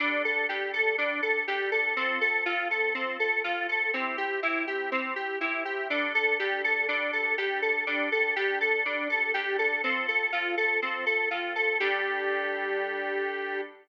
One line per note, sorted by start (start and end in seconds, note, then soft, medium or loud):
0.00 0.44 G3 medium
0.00 0.22 D4 loud
0.00 0.44 D4 medium
0.00 0.44 A4 medium
0.25 0.47 A4 medium
0.49 0.93 G3 medium
0.49 0.93 D4 medium
0.49 0.72 G4 medium
0.49 0.93 A4 medium
0.73 0.96 A4 medium
0.98 1.43 G3 medium
0.98 1.21 D4 loud
0.98 1.43 D4 medium
0.98 1.43 A4 medium
1.23 1.45 A4 medium
1.48 1.92 G3 medium
1.48 1.92 D4 medium
1.48 1.70 G4 loud
1.48 1.92 A4 medium
1.72 1.94 A4 medium
1.97 2.41 F3 medium
1.97 2.19 C4 loud
1.97 2.41 C4 medium
1.97 2.41 A4 medium
2.21 2.44 A4 medium
2.46 2.90 F3 medium
2.46 2.90 C4 medium
2.46 2.68 F4 loud
2.46 2.90 A4 medium
2.71 2.93 A4 medium
2.94 3.39 F3 medium
2.94 3.17 C4 loud
2.94 3.39 C4 medium
2.94 3.39 A4 medium
3.20 3.42 A4 medium
3.44 3.89 F3 medium
3.44 3.89 C4 medium
3.44 3.67 F4 medium
3.44 3.89 A4 medium
3.69 3.92 A4 medium
3.93 4.38 C4 medium
3.93 4.16 C4 medium
3.93 4.38 E4 medium
3.93 4.38 G4 medium
4.18 4.40 G4 medium
4.43 4.87 C4 medium
4.43 4.87 E4 medium
4.43 4.65 E4 loud
4.43 4.87 G4 medium
4.67 4.90 G4 medium
4.92 5.14 C4 loud
4.92 5.36 C4 medium
4.92 5.36 E4 medium
4.92 5.36 G4 medium
5.16 5.39 G4 medium
5.41 5.85 C4 medium
5.41 5.63 E4 medium
5.41 5.85 E4 medium
5.41 5.85 G4 medium
5.65 5.88 G4 medium
5.90 6.34 G3 medium
5.90 6.13 D4 medium
5.90 6.34 D4 medium
5.90 6.34 A4 medium
6.15 6.37 A4 loud
6.39 6.84 G3 medium
6.39 6.84 D4 medium
6.39 6.62 G4 loud
6.39 6.84 A4 medium
6.64 6.87 A4 medium
6.88 7.33 G3 medium
6.88 7.11 D4 medium
6.88 7.33 D4 medium
6.88 7.33 A4 medium
7.13 7.36 A4 medium
7.38 7.82 G3 medium
7.38 7.82 D4 medium
7.38 7.60 G4 medium
7.38 7.82 A4 medium
7.62 7.85 A4 medium
7.87 8.31 G3 medium
7.87 8.09 D4 medium
7.87 8.31 D4 medium
7.87 8.31 A4 medium
8.12 8.35 A4 medium
8.36 8.80 G3 medium
8.36 8.80 D4 medium
8.36 8.59 G4 loud
8.36 8.80 A4 medium
8.61 8.83 A4 medium
8.85 9.30 G3 medium
8.85 9.30 D4 medium
8.85 9.08 D4 medium
8.85 9.30 A4 medium
9.10 9.32 A4 medium
9.34 9.79 G3 medium
9.34 9.79 D4 medium
9.34 9.57 G4 loud
9.34 9.79 A4 medium
9.59 9.81 A4 medium
9.84 10.28 F3 medium
9.84 10.28 C4 medium
9.84 10.06 C4 medium
9.84 10.28 A4 medium
10.08 10.31 A4 medium
10.32 10.77 F3 medium
10.32 10.77 C4 medium
10.32 10.55 F4 medium
10.32 10.77 A4 medium
10.57 10.80 A4 medium
10.82 11.26 F3 medium
10.82 11.26 C4 medium
10.82 11.05 C4 medium
10.82 11.26 A4 medium
11.06 11.29 A4 medium
11.31 11.75 F3 medium
11.31 11.75 C4 medium
11.31 11.53 F4 medium
11.31 11.75 A4 medium
11.56 11.78 A4 medium
11.80 13.61 G3 loud
11.80 13.61 D4 loud
11.80 13.61 G4 loud
11.80 13.61 A4 medium